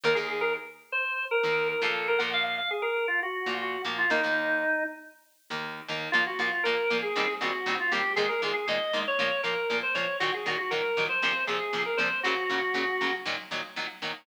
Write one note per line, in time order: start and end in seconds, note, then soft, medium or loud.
0.04 0.14 D#2 medium
0.04 0.14 D#3 medium
0.04 0.14 A#3 medium
0.04 0.17 A#4 medium
0.15 0.57 D#2 medium
0.15 0.57 D#3 medium
0.15 0.57 A#3 medium
0.15 0.27 G#4 medium
0.30 0.42 G#4 medium
0.41 0.53 A#4 medium
0.92 1.25 C5 medium
1.31 1.68 A#4 medium
1.43 1.74 D#2 medium
1.43 1.74 D#3 medium
1.43 1.74 A#3 medium
1.69 1.81 A#4 medium
1.82 2.17 A#2 medium
1.82 2.17 F3 medium
1.82 2.17 A#3 medium
1.82 2.07 A4 medium
2.08 2.20 A#4 loud
2.18 2.60 A#2 medium
2.18 2.60 F3 medium
2.18 2.60 A#3 medium
2.18 2.31 F#5 medium
2.33 2.43 F5 loud
2.44 2.56 F5 medium
2.58 2.70 F5 medium
2.71 2.83 G#4 medium
2.82 3.06 A#4 medium
3.08 3.20 F4 medium
3.23 3.54 F#4 medium
3.46 3.77 A#2 medium
3.46 3.77 F3 medium
3.46 3.77 A#3 medium
3.61 3.82 F#4 medium
3.85 4.05 A#2 medium
3.85 4.05 F3 medium
3.85 4.05 A#3 medium
3.98 4.10 F4 medium
4.10 4.20 D#2 medium
4.10 4.20 D#3 medium
4.10 4.20 A#3 medium
4.10 4.84 D#4 loud
4.23 4.64 D#2 medium
4.23 4.64 D#3 medium
4.23 4.64 A#3 medium
5.50 5.81 D#2 medium
5.50 5.81 D#3 medium
5.50 5.81 A#3 medium
5.88 6.09 D#2 medium
5.88 6.09 D#3 medium
5.88 6.09 A#3 medium
6.12 6.24 A#2 medium
6.12 6.24 F3 medium
6.12 6.24 A#3 medium
6.12 6.24 F4 medium
6.27 6.39 F#4 medium
6.39 6.49 A#2 medium
6.39 6.49 F3 medium
6.39 6.49 A#3 medium
6.39 6.51 F4 medium
6.52 6.64 F4 medium
6.64 6.75 A#2 medium
6.64 6.75 F3 medium
6.64 6.75 A#3 medium
6.64 6.98 A#4 medium
6.90 7.01 A#2 medium
6.90 7.01 F3 medium
6.90 7.01 A#3 medium
7.02 7.33 G#4 medium
7.16 7.26 A#2 medium
7.16 7.26 D#3 medium
7.16 7.26 G3 medium
7.16 7.26 C4 medium
7.41 7.51 A#2 medium
7.41 7.51 D#3 medium
7.41 7.51 G3 medium
7.41 7.51 C4 medium
7.41 7.74 F#4 medium
7.66 7.76 A#2 medium
7.66 7.76 D#3 medium
7.66 7.76 G3 medium
7.66 7.76 C4 medium
7.80 7.92 F4 medium
7.92 8.02 A#2 medium
7.92 8.02 D#3 medium
7.92 8.02 G3 medium
7.92 8.02 C4 medium
7.92 8.13 G4 medium
8.16 8.27 A#2 medium
8.16 8.27 D#3 medium
8.16 8.27 G#3 medium
8.16 8.28 G#4 loud
8.29 8.41 A#4 medium
8.42 8.52 A#2 medium
8.42 8.52 D#3 medium
8.42 8.52 G#3 medium
8.42 8.53 G#4 medium
8.54 8.66 G#4 medium
8.68 8.78 A#2 medium
8.68 8.78 D#3 medium
8.68 8.78 G#3 medium
8.68 9.00 D#5 medium
8.93 9.03 A#2 medium
8.93 9.03 D#3 medium
8.93 9.03 G#3 medium
9.07 9.41 C#5 medium
9.19 9.29 A#2 medium
9.19 9.29 F3 medium
9.19 9.29 A#3 medium
9.43 9.54 A#2 medium
9.43 9.54 F3 medium
9.43 9.54 A#3 medium
9.43 9.77 A#4 medium
9.70 9.80 A#2 medium
9.70 9.80 F3 medium
9.70 9.80 A#3 medium
9.83 9.95 C5 medium
9.94 10.05 A#2 medium
9.94 10.05 F3 medium
9.94 10.05 A#3 medium
9.94 10.17 C#5 medium
10.20 10.31 A#2 medium
10.20 10.31 D#3 medium
10.20 10.31 F#3 medium
10.20 10.32 F#4 loud
10.34 10.46 G#4 medium
10.46 10.56 A#2 medium
10.46 10.56 D#3 medium
10.46 10.56 F#3 medium
10.46 10.58 F#4 medium
10.58 10.71 F#4 medium
10.71 10.81 A#2 medium
10.71 10.81 D#3 medium
10.71 10.81 F#3 medium
10.71 11.04 A#4 medium
10.97 11.07 A#2 medium
10.97 11.07 D#3 medium
10.97 11.07 F#3 medium
11.09 11.44 C5 medium
11.22 11.33 A#2 medium
11.22 11.33 C3 medium
11.22 11.33 F3 medium
11.47 11.58 A#2 medium
11.47 11.58 C3 medium
11.47 11.58 F3 medium
11.47 11.83 G#4 medium
11.73 11.83 A#2 medium
11.73 11.83 C3 medium
11.73 11.83 F3 medium
11.86 11.98 A#4 medium
11.97 12.08 A#2 medium
11.97 12.08 C3 medium
11.97 12.08 F3 medium
11.97 12.20 C5 medium
12.23 12.34 A#2 medium
12.23 12.34 C#3 medium
12.23 12.34 F#3 medium
12.23 13.13 F#4 loud
12.50 12.60 A#2 medium
12.50 12.60 C#3 medium
12.50 12.60 F#3 medium
12.74 12.84 A#2 medium
12.74 12.84 C#3 medium
12.74 12.84 F#3 medium
13.01 13.11 A#2 medium
13.01 13.11 C#3 medium
13.01 13.11 F#3 medium
13.26 13.36 A#2 medium
13.26 13.36 D#3 medium
13.26 13.36 F#3 medium
13.51 13.61 A#2 medium
13.51 13.61 D#3 medium
13.51 13.61 F#3 medium
13.76 13.86 A#2 medium
13.76 13.86 D#3 medium
13.76 13.86 F#3 medium
14.02 14.12 A#2 medium
14.02 14.12 D#3 medium
14.02 14.12 F#3 medium